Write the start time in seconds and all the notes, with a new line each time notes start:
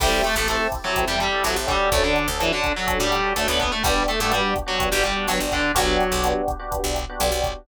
0.00 A1 G3 C4 E4 G4 A4, kick, cross-stick, crash
0.24 A3 A4, closed hi-hat
0.35 A1 A3 C4 E4 G4 A4
0.48 A3 C4 E4 G4 A4, closed hi-hat
0.72 kick, cross-stick, closed hi-hat
0.84 F#3 C4 E4 F#4 G4 A4
0.96 C4 E4 G4 A4, kick, closed hi-hat
1.07 E2 G3 G4
1.20 G3 G4, closed hi-hat
1.32 C4 E4 G4 A4
1.44 A1 F#3 C4 E4 F#4 G4 A4, cross-stick, closed hi-hat
1.56 A1
1.67 G3 C#4 D4 F#4 G4 A4, kick, closed hi-hat
1.92 D2 A3 A4, kick, closed hi-hat
2.04 D3 D4
2.16 closed hi-hat
2.28 D2 C#4 D4 F#4 A4
2.40 E3 C#4 D4 E4 F#4 A4, cross-stick, closed hi-hat
2.53 D3 D4
2.64 kick, closed hi-hat
2.76 F#3 C#4 D4 F#4 A4
2.87 C#4 D4 F#4 A4, kick, closed hi-hat
3.00 A2 G3 G4
3.12 cross-stick, closed hi-hat
3.23 C#4 D4 F#4 A4
3.36 D2 A3 C#4 D4 F#4 A4, closed hi-hat
3.48 D2 B3 B4
3.60 B3 B4, kick, closed hi-hat
3.72 A3 A4
3.83 G1 G3 B3 D4 F#4 G4, kick, cross-stick, closed hi-hat
4.08 A3 A4, closed hi-hat
4.20 G2 A3 B3 D4 F#4 G4 A4
4.30 G3 B3 D4 F#4 G4, closed hi-hat
4.56 kick, cross-stick, closed hi-hat
4.66 F#3 B3 D4 F#4 G4
4.79 B3 D4 F#4 G4, kick, closed hi-hat
4.92 G1 G3 G4
5.04 G3 G4, closed hi-hat
5.17 B3 D4 F#4 G4
5.28 G1 F#3 B3 D4 F#4 G4, cross-stick, closed hi-hat
5.40 G1
5.52 D3 D4, kick, closed hi-hat
5.75 B1 F#3 B3 D4 F#4 G4, kick, closed hi-hat
6.00 closed hi-hat
6.11 B1 B3 D4 F#4 G4
6.23 B3 D4 F#4 G4, cross-stick, closed hi-hat
6.48 kick, closed hi-hat
6.59 B3 D4 F#4 G4
6.71 B3 D4 F#4 G4, kick, closed hi-hat
6.84 B1
6.96 cross-stick, closed hi-hat
7.09 B3 D4 F#4 G4
7.20 B1 B3 D4 F#4 G4, closed hi-hat
7.32 B1
7.44 kick, closed hi-hat